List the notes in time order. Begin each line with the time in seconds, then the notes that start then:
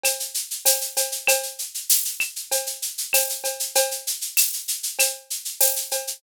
0.03 cowbell, claves, shaker
0.20 shaker
0.34 shaker
0.51 shaker
0.65 tambourine, cowbell, shaker
0.81 shaker
0.97 cowbell, shaker
1.12 shaker
1.27 cowbell, claves, shaker
1.43 shaker
1.59 shaker
1.74 shaker
1.90 tambourine, shaker
2.05 shaker
2.20 claves, shaker
2.36 shaker
2.52 cowbell, shaker
2.66 shaker
2.82 shaker
2.98 shaker
3.13 tambourine, cowbell, claves, shaker
3.29 shaker
3.44 cowbell, shaker
3.60 shaker
3.75 cowbell, shaker
3.91 shaker
4.07 shaker
4.21 shaker
4.37 tambourine, claves, shaker
4.53 shaker
4.68 shaker
4.83 shaker
4.99 cowbell, claves, shaker
5.30 shaker
5.45 shaker
5.61 tambourine, cowbell, shaker
5.76 shaker
5.91 cowbell, shaker
6.07 shaker